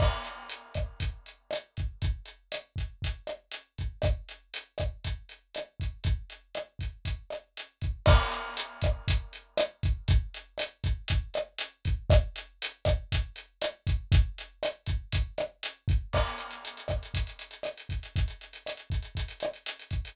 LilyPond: \new DrumStaff \drummode { \time 4/4 \tempo 4 = 119 <cymc bd ss>8 hh8 hh8 <hh bd ss>8 <hh bd>8 hh8 <hh ss>8 <hh bd>8 | <hh bd>8 hh8 <hh ss>8 <hh bd>8 <hh bd>8 <hh ss>8 hh8 <hh bd>8 | <hh bd ss>8 hh8 hh8 <hh bd ss>8 <hh bd>8 hh8 <hh ss>8 <hh bd>8 | <hh bd>8 hh8 <hh ss>8 <hh bd>8 <hh bd>8 <hh ss>8 hh8 <hh bd>8 |
<cymc bd ss>8 hh8 hh8 <hh bd ss>8 <hh bd>8 hh8 <hh ss>8 <hh bd>8 | <hh bd>8 hh8 <hh ss>8 <hh bd>8 <hh bd>8 <hh ss>8 hh8 <hh bd>8 | <hh bd ss>8 hh8 hh8 <hh bd ss>8 <hh bd>8 hh8 <hh ss>8 <hh bd>8 | <hh bd>8 hh8 <hh ss>8 <hh bd>8 <hh bd>8 <hh ss>8 hh8 <hh bd>8 |
<cymc bd ss>16 hh16 hh16 hh16 hh16 hh16 <hh bd ss>16 hh16 <hh bd>16 hh16 hh16 hh16 <hh ss>16 hh16 <hh bd>16 hh16 | <hh bd>16 hh16 hh16 hh16 <hh ss>16 hh16 <hh bd>16 hh16 <hh bd>16 hh16 <hh ss>16 hh16 hh16 hh16 <hh bd>16 hh16 | }